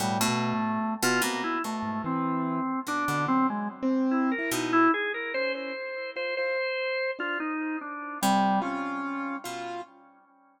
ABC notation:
X:1
M:6/4
L:1/16
Q:1/4=73
K:none
V:1 name="Drawbar Organ"
G, A,4 F ^A, E =A,2 C4 D2 C ^G, z2 E ^A ^D E | ^G ^A c c3 c c4 F ^D2 =D2 =G,2 ^C4 z2 |]
V:2 name="Pizzicato Strings" clef=bass
B,, B,,4 B,, B,,2 B,,6 B,, B,,7 B,,2 | z16 C,6 B,,2 |]
V:3 name="Acoustic Grand Piano"
(3A,,2 B,,2 A,,2 z2 C, z2 ^G,, E,3 z2 D, (3^F,4 C4 E4 | z2 ^C2 z2 F F z3 D z4 F2 F4 F2 |]